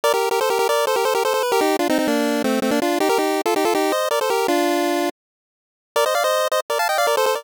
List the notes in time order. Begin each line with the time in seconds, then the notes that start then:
0.04 A#4 D5
0.14 G4 A#4
0.31 G4 A#4
0.41 A4 C5
0.50 G4 A#4
0.59 G4 A#4
0.69 A#4 D5
0.87 A4 C5
0.96 G4 A#4
1.05 A4 C5
1.15 G4 A#4
1.25 A4 C5
1.34 A4 C5
1.43 B4
1.52 G4 A#4
1.61 D#4 G4
1.79 D4 F4
1.89 C4 D#4
1.99 C4 D#4
2.08 A#3 D4
2.44 A3 C4
2.62 A3 C4
2.71 A#3 D4
2.82 D4 F4
3.00 D#4 G4
3.09 G4 A#4
3.18 D#4 G4
3.46 F4 A4
3.56 D#4 G4
3.65 F4 A4
3.75 D#4 G4
3.92 C5 D#5
4.11 A#4 D5
4.21 A4 C5
4.30 G4 A#4
4.48 D4 F4
5.96 A#4 D5
6.06 C5 D#5
6.15 D5 F5
6.24 C5 D#5
6.52 C5 D#5
6.70 A#4 D5
6.79 F5 A5
6.89 D#5 G5
6.98 D5 F5
7.07 A#4 D5
7.17 A4 C5
7.26 A4 C5
7.35 A#4 D5